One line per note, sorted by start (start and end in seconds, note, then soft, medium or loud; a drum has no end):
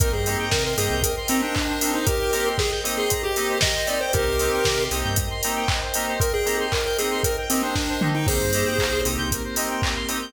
0.00 0.12 C2 medium
0.00 0.09 A#3 medium
0.00 0.09 C4 medium
0.00 0.09 D#4 medium
0.00 0.09 G4 medium
0.00 0.12 A#4 loud
0.00 4.09 A#4 loud
0.00 0.12 A#4 medium
0.00 4.09 C5 medium
0.00 4.09 D#5 medium
0.00 4.09 G5 loud
0.00 kick loud
0.00 closed hi-hat loud
0.13 0.36 G2 medium
0.13 0.37 G#4 medium
0.13 0.24 C5 medium
0.26 0.45 A#3 medium
0.26 0.45 C4 medium
0.26 0.45 D#4 medium
0.26 0.45 G4 medium
0.26 0.37 D#5 medium
0.26 open hi-hat medium
0.39 0.51 G5 loud
0.51 0.75 C3 medium
0.51 0.64 A#4 medium
0.51 0.63 A#5 loud
0.51 kick medium
0.51 snare loud
0.65 0.77 A#4 medium
0.65 0.76 C6 medium
0.77 0.89 G2 medium
0.77 0.95 A#3 medium
0.77 0.95 C4 medium
0.77 0.95 D#4 medium
0.77 0.95 G4 medium
0.77 1.02 G#4 medium
0.77 0.89 D#6 medium
0.77 open hi-hat medium
0.90 1.14 C2 medium
0.90 1.02 G6 medium
1.03 1.16 A#4 medium
1.03 1.15 D#6 loud
1.03 kick medium
1.03 closed hi-hat loud
1.16 1.28 C6 medium
1.28 1.47 A#3 medium
1.28 1.47 C4 medium
1.28 1.42 C4 medium
1.28 1.47 D#4 medium
1.28 1.47 G4 medium
1.28 1.41 A#5 medium
1.28 open hi-hat medium
1.42 1.91 D4 medium
1.42 1.54 G5 medium
1.55 1.67 D#5 medium
1.55 kick medium
1.55 clap loud
1.68 1.80 C5 medium
1.81 2.00 A#3 medium
1.81 2.00 C4 medium
1.81 2.00 D#4 medium
1.81 2.00 G4 medium
1.81 1.92 A#4 medium
1.81 open hi-hat medium
1.94 2.06 D#4 medium
1.94 2.05 C5 medium
2.07 2.49 G4 medium
2.07 2.49 A#4 medium
2.07 2.19 D#5 loud
2.07 kick loud
2.07 closed hi-hat medium
2.20 2.32 G5 medium
2.33 2.51 A#3 medium
2.33 2.51 C4 medium
2.33 2.51 D#4 medium
2.33 2.51 G4 medium
2.33 2.44 A#5 medium
2.33 open hi-hat medium
2.46 2.57 C6 medium
2.58 2.71 G#4 medium
2.58 2.70 D#6 medium
2.58 kick medium
2.58 snare medium
2.71 2.83 G6 medium
2.84 3.02 A#3 medium
2.84 3.02 C4 medium
2.84 3.02 D#4 medium
2.84 3.02 G4 medium
2.84 2.96 D#6 medium
2.84 open hi-hat medium
2.97 3.22 G#4 medium
2.97 3.09 C6 medium
3.10 3.22 A#5 loud
3.10 kick medium
3.10 closed hi-hat loud
3.23 3.58 G4 medium
3.23 3.35 G5 medium
3.36 3.55 A#3 medium
3.36 3.55 C4 medium
3.36 3.55 D#4 medium
3.36 3.55 G4 medium
3.36 3.48 D#5 medium
3.36 open hi-hat medium
3.49 3.61 C5 medium
3.61 3.74 A#4 loud
3.61 3.87 D#5 medium
3.61 kick medium
3.61 snare loud
3.75 3.87 C5 medium
3.87 3.96 A#3 medium
3.87 3.96 C4 medium
3.87 3.96 D#4 medium
3.87 3.96 G4 medium
3.87 4.00 D5 medium
3.87 3.99 D#5 medium
3.87 open hi-hat medium
4.01 4.13 C5 medium
4.01 4.12 G5 medium
4.13 4.26 C2 medium
4.13 4.23 A#3 loud
4.13 4.23 C4 medium
4.13 4.23 D#4 loud
4.13 4.84 G4 medium
4.13 4.23 G4 loud
4.13 8.23 A#4 medium
4.13 4.84 A#4 medium
4.13 4.25 A#4 loud
4.13 8.23 C5 medium
4.13 8.23 D#5 medium
4.13 8.23 G5 medium
4.13 kick loud
4.13 closed hi-hat medium
4.27 4.50 C2 medium
4.27 4.38 C5 medium
4.39 4.58 A#3 medium
4.39 4.58 C4 medium
4.39 4.58 D#4 medium
4.39 4.58 G4 medium
4.39 4.51 D#5 medium
4.39 open hi-hat medium
4.53 4.64 G5 medium
4.65 4.89 C3 medium
4.65 4.77 A#5 medium
4.65 kick medium
4.65 snare loud
4.78 4.90 C6 medium
4.91 5.03 C2 medium
4.91 5.10 A#3 medium
4.91 5.10 C4 medium
4.91 5.10 D#4 medium
4.91 5.10 G4 medium
4.91 5.03 D#6 medium
4.91 open hi-hat medium
5.04 5.28 G2 medium
5.04 5.16 G6 medium
5.16 5.29 D#6 loud
5.16 kick medium
5.16 closed hi-hat loud
5.30 5.42 C6 medium
5.43 5.62 A#3 medium
5.43 5.62 C4 medium
5.43 5.62 D#4 medium
5.43 5.62 G4 medium
5.43 5.55 A#5 medium
5.43 open hi-hat medium
5.56 5.68 G5 medium
5.68 5.80 D#5 medium
5.68 kick medium
5.68 clap loud
5.82 5.94 C5 medium
5.94 6.13 A#3 medium
5.94 6.13 C4 medium
5.94 6.13 D#4 medium
5.94 6.13 G4 medium
5.94 6.07 A#4 medium
5.94 open hi-hat medium
6.08 6.20 C5 medium
6.20 6.33 A#4 medium
6.20 6.32 D#5 loud
6.20 kick loud
6.20 closed hi-hat medium
6.34 6.57 G#4 medium
6.34 6.45 G5 loud
6.46 6.64 A#3 medium
6.46 6.64 C4 medium
6.46 6.64 D#4 medium
6.46 6.64 G4 medium
6.46 6.58 A#5 medium
6.46 open hi-hat medium
6.60 6.71 C6 medium
6.72 6.85 A#4 medium
6.72 6.84 D#6 medium
6.72 kick medium
6.72 clap loud
6.85 6.98 A#4 medium
6.85 6.97 G6 medium
6.98 7.17 A#3 medium
6.98 7.17 C4 medium
6.98 7.17 D#4 medium
6.98 7.17 G4 medium
6.98 7.20 G#4 medium
6.98 7.10 D#6 medium
6.98 open hi-hat medium
7.11 7.23 C6 medium
7.23 7.37 A#4 medium
7.23 7.36 A#5 medium
7.23 kick medium
7.23 closed hi-hat loud
7.37 7.49 G5 medium
7.50 7.68 A#3 medium
7.50 7.62 C4 medium
7.50 7.68 C4 medium
7.50 7.68 D#4 medium
7.50 7.68 G4 medium
7.50 7.62 D#5 medium
7.50 open hi-hat medium
7.63 8.08 D4 medium
7.63 7.75 C5 medium
7.76 7.87 A#4 medium
7.76 kick medium
7.76 snare medium
7.89 8.01 C5 medium
8.01 8.11 A#3 medium
8.01 8.11 C4 medium
8.01 8.11 D#4 medium
8.01 8.11 G4 medium
8.01 8.14 D#5 medium
8.01 mid tom loud
8.15 8.27 D#4 medium
8.15 8.26 G5 medium
8.27 8.39 C2 medium
8.27 9.30 A#3 medium
8.27 8.37 A#3 medium
8.27 9.30 C4 medium
8.27 8.37 C4 medium
8.27 9.30 D#4 loud
8.27 8.37 D#4 medium
8.27 9.30 G4 medium
8.27 8.37 G4 loud
8.27 9.01 G#4 medium
8.27 8.39 A#4 loud
8.27 9.01 C5 loud
8.27 kick loud
8.27 crash medium
8.40 8.64 G2 medium
8.40 8.52 C5 medium
8.53 8.72 A#3 medium
8.53 8.72 C4 medium
8.53 8.72 D#4 medium
8.53 8.72 G4 medium
8.53 8.65 D#5 medium
8.53 open hi-hat medium
8.66 8.78 G5 medium
8.79 9.02 C2 medium
8.79 8.91 A#5 medium
8.79 kick medium
8.79 clap loud
8.92 9.04 C6 medium
9.05 9.17 C2 medium
9.05 9.23 A#3 medium
9.05 9.23 C4 medium
9.05 9.23 D#4 medium
9.05 9.23 G4 medium
9.05 9.17 D#6 medium
9.05 open hi-hat medium
9.18 9.41 C2 medium
9.18 9.30 G6 medium
9.31 10.33 A#3 medium
9.31 10.33 C4 loud
9.31 10.33 G4 medium
9.31 9.43 A#4 loud
9.31 10.33 A#4 medium
9.31 kick medium
9.31 closed hi-hat medium
9.44 9.55 C5 medium
9.56 9.75 A#3 medium
9.56 9.75 C4 medium
9.56 9.75 D#4 medium
9.56 9.75 G4 medium
9.56 9.68 D#5 medium
9.56 open hi-hat medium
9.70 9.81 G5 medium
9.82 9.95 A#5 medium
9.82 kick medium
9.82 clap loud
9.96 10.07 C6 medium
10.09 10.18 A#3 medium
10.09 10.18 C4 medium
10.09 10.18 D#4 medium
10.09 10.18 G4 medium
10.09 10.20 D#6 medium
10.09 open hi-hat medium
10.21 10.33 G6 medium